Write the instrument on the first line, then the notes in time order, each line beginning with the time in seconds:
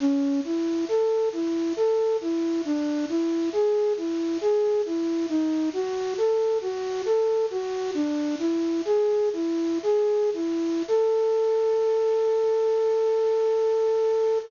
flute
0.00 C#4
0.44 E4
0.88 A4
1.33 E4
1.76 A4
2.21 E4
2.65 D4
3.09 E4
3.53 G#4
3.97 E4
4.41 G#4
4.86 E4
5.29 D#4
5.73 F#4
6.18 A4
6.61 F#4
7.06 A4
7.50 F#4
7.94 D4
8.39 E4
8.85 G#4
9.33 E4
9.83 G#4
10.34 E4
10.88 A4